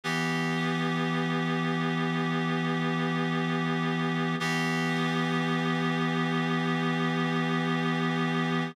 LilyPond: \new Staff { \time 4/4 \key b \minor \tempo 4 = 55 <e b g'>1 | <e b g'>1 | }